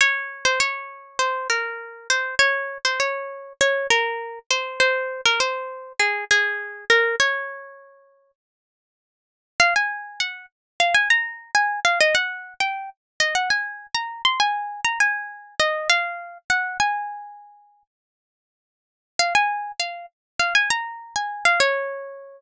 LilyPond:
\new Staff { \time 4/4 \key des \major \tempo 4 = 100 des''8. c''16 des''4 c''8 bes'4 c''8 | des''8. c''16 des''4 des''8 bes'4 c''8 | c''8. bes'16 c''4 aes'8 aes'4 bes'8 | des''2 r2 |
f''16 aes''8. ges''8 r8 f''16 aes''16 bes''8. aes''8 f''16 | ees''16 fis''8. g''8 r8 ees''16 ges''16 aes''8. bes''8 c'''16 | aes''8. bes''16 aes''4 ees''8 f''4 ges''8 | aes''2 r2 |
f''16 aes''8. f''8 r8 f''16 aes''16 bes''8. aes''8 f''16 | des''2. r4 | }